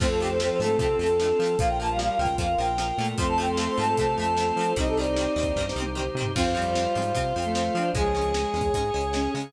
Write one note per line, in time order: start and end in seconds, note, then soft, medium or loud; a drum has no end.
0.00 0.51 F2 medium
0.00 0.07 F3 loud
0.00 0.38 A3 loud
0.00 0.07 A3 loud
0.00 0.38 C4 loud
0.00 1.55 C4 medium
0.00 1.57 C4 medium
0.00 0.07 C4 loud
0.00 1.55 F4 medium
0.00 1.57 F4 medium
0.00 1.55 A4 loud
0.00 1.57 A4 medium
0.00 0.09 C5 medium
0.00 kick loud
0.00 crash loud
0.10 0.19 A4 medium
0.20 0.28 F3 medium
0.20 0.28 A3 medium
0.20 0.29 G4 medium
0.24 0.28 C4 medium
0.24 closed hi-hat medium
0.30 0.39 C5 medium
0.39 0.59 F3 loud
0.39 0.48 F3 medium
0.39 0.48 A3 medium
0.39 0.49 C5 medium
0.39 snare loud
0.44 0.48 C4 medium
0.51 0.60 C5 medium
0.59 0.76 G#2 medium
0.59 0.68 F3 medium
0.59 0.77 A3 loud
0.59 0.68 A3 loud
0.59 0.77 A4 medium
0.64 0.68 C4 medium
0.64 closed hi-hat medium
0.78 0.95 C3 medium
0.78 0.87 F3 medium
0.78 0.87 A3 medium
0.78 1.11 C4 loud
0.78 0.97 A4 medium
0.78 kick medium
0.78 closed hi-hat medium
0.83 0.87 C4 medium
0.99 1.33 F2 medium
0.99 1.07 F3 medium
0.99 1.07 A3 medium
0.99 1.59 A4 medium
1.03 1.07 C4 medium
1.03 closed hi-hat medium
1.19 1.27 F3 medium
1.19 1.27 A3 medium
1.19 1.29 D4 loud
1.19 snare loud
1.23 1.27 C4 medium
1.39 1.56 F3 medium
1.39 1.48 F3 medium
1.39 1.48 A3 medium
1.44 1.48 C4 loud
1.44 closed hi-hat medium
1.59 2.10 A#1 medium
1.59 1.88 F3 loud
1.59 1.68 F3 loud
1.59 1.68 A#3 medium
1.59 3.17 F4 medium
1.59 3.16 F4 medium
1.59 3.17 A#4 medium
1.59 3.16 A#4 medium
1.59 1.68 F5 medium
1.59 kick loud
1.59 closed hi-hat loud
1.68 1.77 G5 medium
1.80 1.88 F3 medium
1.80 1.88 A#3 medium
1.80 1.90 A5 medium
1.86 2.15 G3 medium
1.86 closed hi-hat medium
1.91 1.99 F5 medium
1.99 2.07 F3 medium
1.99 2.07 A#3 medium
1.99 2.09 F5 medium
1.99 snare loud
2.09 2.18 F5 medium
2.18 2.36 C#2 medium
2.18 2.27 F3 medium
2.18 2.27 A#3 medium
2.18 2.35 G5 medium
2.25 kick medium
2.25 closed hi-hat medium
2.38 2.55 F2 medium
2.38 2.47 F3 loud
2.38 2.47 A#3 medium
2.38 2.59 F5 medium
2.38 kick medium
2.38 closed hi-hat medium
2.58 2.92 A#1 medium
2.58 2.66 F3 medium
2.58 2.66 A#3 medium
2.58 3.07 G5 medium
2.65 closed hi-hat medium
2.78 2.86 F3 medium
2.78 2.86 A#3 medium
2.78 snare medium
2.98 3.15 A#2 medium
2.98 3.06 F3 medium
2.98 3.15 A3 loud
2.98 3.06 A#3 medium
3.05 closed hi-hat medium
3.18 3.68 F2 medium
3.18 3.26 F3 loud
3.18 4.66 A3 loud
3.18 3.26 A3 loud
3.18 4.66 C4 loud
3.18 4.75 F4 medium
3.18 4.75 A4 medium
3.18 4.75 C5 medium
3.18 3.27 C6 loud
3.18 kick loud
3.18 closed hi-hat medium
3.22 3.26 C4 loud
3.28 3.38 A5 medium
3.38 3.46 F3 medium
3.38 3.46 A3 loud
3.38 3.46 C4 medium
3.38 3.49 G5 medium
3.45 closed hi-hat medium
3.49 3.57 C6 medium
3.57 3.65 F3 medium
3.57 3.65 A3 medium
3.57 3.65 C4 medium
3.57 3.67 C6 medium
3.57 snare loud
3.68 3.78 C6 medium
3.77 3.95 G#2 medium
3.77 3.85 F3 medium
3.77 3.85 A3 medium
3.77 3.85 C4 medium
3.77 3.95 A5 medium
3.84 closed hi-hat medium
3.97 4.15 C3 medium
3.97 4.05 F3 medium
3.97 4.05 A3 medium
3.97 4.05 C4 medium
3.97 4.15 A5 medium
3.97 kick medium
3.97 closed hi-hat medium
4.18 4.52 F2 medium
4.18 4.25 F3 medium
4.18 4.25 A3 medium
4.18 4.25 C4 medium
4.18 4.70 A5 medium
4.24 closed hi-hat medium
4.37 4.45 F3 medium
4.37 4.45 A3 medium
4.37 4.45 C4 loud
4.37 snare loud
4.56 4.73 F3 medium
4.56 4.65 F3 medium
4.56 4.65 A3 medium
4.61 4.65 C4 medium
4.61 closed hi-hat medium
4.76 5.27 C2 medium
4.76 4.85 D#3 loud
4.76 4.85 G3 loud
4.76 5.52 C4 medium
4.76 6.32 D#4 medium
4.76 5.52 D#4 loud
4.76 6.35 D#4 medium
4.76 6.32 G4 loud
4.76 6.35 G4 medium
4.76 6.32 C5 medium
4.76 6.35 C5 medium
4.76 4.88 D#5 loud
4.76 kick medium
4.76 closed hi-hat loud
4.81 4.85 C4 loud
4.88 4.97 A4 medium
4.97 5.05 D#3 medium
4.97 5.05 G3 medium
4.97 5.05 C4 medium
4.97 5.63 D5 medium
5.04 closed hi-hat medium
5.16 5.25 D#3 medium
5.16 5.25 G3 medium
5.16 snare loud
5.21 5.25 C4 medium
5.36 5.53 D#2 medium
5.36 5.44 D#3 medium
5.36 5.44 G3 medium
5.36 5.44 C4 medium
5.43 kick medium
5.43 closed hi-hat medium
5.56 5.73 G2 medium
5.56 5.65 D#3 medium
5.56 5.65 G3 medium
5.56 kick medium
5.56 snare medium
5.61 5.65 C4 medium
5.69 snare medium
5.76 6.10 C2 medium
5.76 5.84 D#3 medium
5.76 5.84 G3 medium
5.80 5.84 C4 medium
5.80 high tom medium
5.95 6.03 D#3 medium
5.95 6.03 G3 medium
5.95 6.03 C4 medium
5.95 mid tom medium
6.15 6.32 C3 medium
6.15 6.25 D#3 medium
6.15 6.25 G3 medium
6.21 6.25 C4 medium
6.21 floor tom loud
6.35 6.87 F2 medium
6.35 6.44 F3 loud
6.35 6.52 C4 loud
6.35 6.44 C4 loud
6.35 7.90 F4 medium
6.35 7.89 F4 medium
6.35 7.93 F4 medium
6.35 7.90 C5 loud
6.35 7.93 C5 medium
6.35 kick medium
6.35 crash loud
6.55 6.63 F3 loud
6.55 7.13 G3 medium
6.55 6.63 C4 loud
6.62 closed hi-hat medium
6.75 6.84 F3 medium
6.75 6.84 C4 medium
6.75 snare loud
6.95 7.13 G#2 medium
6.95 7.03 F3 medium
6.95 7.03 C4 medium
7.02 closed hi-hat medium
7.14 7.33 C3 medium
7.14 7.22 F3 loud
7.14 7.22 C4 medium
7.14 kick medium
7.14 closed hi-hat medium
7.36 7.70 F2 medium
7.36 7.44 F3 medium
7.36 7.44 C4 medium
7.42 7.72 A3 loud
7.42 closed hi-hat medium
7.55 7.63 F3 medium
7.55 7.63 C4 medium
7.55 snare loud
7.75 7.91 F3 medium
7.75 7.83 F3 medium
7.75 7.83 C4 medium
7.75 7.93 D4 loud
7.81 closed hi-hat medium
7.94 8.45 C#2 medium
7.94 8.32 F3 loud
7.94 8.03 G#3 loud
7.94 8.32 G#3 loud
7.94 8.03 C#4 loud
7.94 9.52 G#4 medium
7.94 9.51 G#4 loud
7.94 9.30 G#4 loud
7.94 9.52 C#5 medium
7.94 9.51 C#5 medium
7.94 kick loud
7.94 closed hi-hat medium
8.15 8.23 G#3 medium
8.15 8.23 C#4 loud
8.22 closed hi-hat medium
8.34 8.67 G#3 medium
8.34 8.42 G#3 medium
8.34 8.42 C#4 medium
8.34 snare loud
8.54 8.71 E2 medium
8.54 8.62 G#3 medium
8.54 8.62 C#4 medium
8.61 kick medium
8.61 closed hi-hat medium
8.74 8.91 G#2 medium
8.74 8.83 G#3 medium
8.74 8.83 C#4 medium
8.74 kick medium
8.74 closed hi-hat medium
8.94 9.28 C#2 medium
8.94 9.02 G#3 medium
8.94 9.02 C#4 medium
9.01 closed hi-hat medium
9.13 9.21 G#3 medium
9.13 9.46 C#4 loud
9.13 9.21 C#4 medium
9.13 snare loud
9.34 9.51 C#3 medium
9.34 9.43 G#3 medium
9.34 9.43 C#4 medium
9.40 closed hi-hat medium